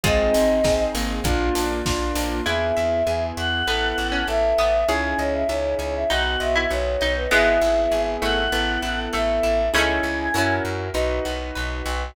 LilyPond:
<<
  \new Staff \with { instrumentName = "Choir Aahs" } { \time 4/4 \key ees \major \tempo 4 = 99 ees''4. r2 r8 | \key e \major e''4. fis''4. e''4 | gis''8 cis''16 e''16 cis''8 cis''16 e''16 fis''8 e''8 cis''8. b'16 | e''4. fis''4. e''4 |
gis''4. r2 r8 | }
  \new Staff \with { instrumentName = "Harpsichord" } { \time 4/4 \key ees \major <f' aes'>4 r2. | \key e \major e'8 r4. b8. cis'8. b8 | gis'8 r4. dis'8. e'8. dis'8 | <gis b>4. a4. a4 |
<a cis'>4 r2. | }
  \new Staff \with { instrumentName = "Acoustic Grand Piano" } { \time 4/4 \key ees \major <c' ees' aes'>4 <c' ees' aes'>4 <bes d' f'>4 <bes d' f'>4 | \key e \major <b e' gis'>4 <b e' gis'>4 <b e' a'>4 <b e' a'>4 | <cis' dis' e' gis'>4 <cis' dis' e' gis'>4 <b dis' fis'>4 <b dis' fis'>4 | <b e' gis'>2 <b e' a'>2 |
<cis' dis' e' gis'>4 <cis' e' fis' ais'>4 <dis' fis' b'>2 | }
  \new Staff \with { instrumentName = "Acoustic Guitar (steel)" } { \time 4/4 \key ees \major aes8 c'8 ees'8 bes4 d'8 f'8 d'8 | \key e \major b'8 e''8 gis''8 e''8 b'8 e''8 a''8 e''8 | cis''8 dis''8 e''8 gis''8 b'8 dis''8 fis''8 dis''8 | b8 e'8 gis'8 e'8 b8 e'8 a'8 e'8 |
<cis' dis' e' gis'>4 <cis' e' fis' ais'>4 dis'8 fis'8 b'8 fis'8 | }
  \new Staff \with { instrumentName = "Electric Bass (finger)" } { \clef bass \time 4/4 \key ees \major aes,,8 aes,,8 aes,,8 aes,,8 bes,,8 bes,,8 bes,,8 bes,,8 | \key e \major e,8 e,8 e,8 e,8 a,,8 a,,8 a,,8 a,,8 | cis,8 cis,8 cis,8 cis,8 b,,8 b,,8 b,,8 b,,8 | gis,,8 gis,,8 gis,,8 gis,,8 a,,8 a,,8 a,,8 a,,8 |
cis,8 cis,8 fis,8 fis,8 b,,8 b,,8 b,,8 b,,8 | }
  \new Staff \with { instrumentName = "String Ensemble 1" } { \time 4/4 \key ees \major <c' ees' aes'>2 <bes d' f'>2 | \key e \major r1 | r1 | r1 |
r1 | }
  \new DrumStaff \with { instrumentName = "Drums" } \drummode { \time 4/4 <hh bd>8 hho8 <bd sn>8 hho8 <hh bd>8 hho8 <bd sn>8 hho8 | r4 r4 r4 r4 | r4 r4 r4 r4 | r4 r4 r4 r4 |
r4 r4 r4 r4 | }
>>